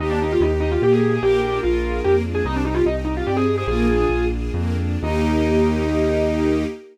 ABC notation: X:1
M:3/4
L:1/16
Q:1/4=147
K:Eb
V:1 name="Acoustic Grand Piano"
E D E F E z E F G A2 A | G4 F4 G z2 A | E D E F E z E F G A2 A | "^rit." A6 z6 |
E12 |]
V:2 name="Violin"
G12 | B12 | z8 d z2 c | "^rit." F6 z6 |
E12 |]
V:3 name="String Ensemble 1"
B,2 G2 E2 G2 B,2 G2 | B,2 D2 F2 A2 B,2 D2 | C2 G2 E2 G2 C2 G2 | "^rit." B,2 D2 F2 A2 B,2 D2 |
[B,EG]12 |]
V:4 name="Acoustic Grand Piano" clef=bass
E,,4 E,,4 B,,4 | B,,,4 B,,,4 F,,4 | C,,4 C,,4 G,,4 | "^rit." B,,,4 B,,,4 F,,4 |
E,,12 |]
V:5 name="String Ensemble 1"
[B,EG]12 | [B,DFA]12 | [CEG]12 | "^rit." [B,DFA]12 |
[B,EG]12 |]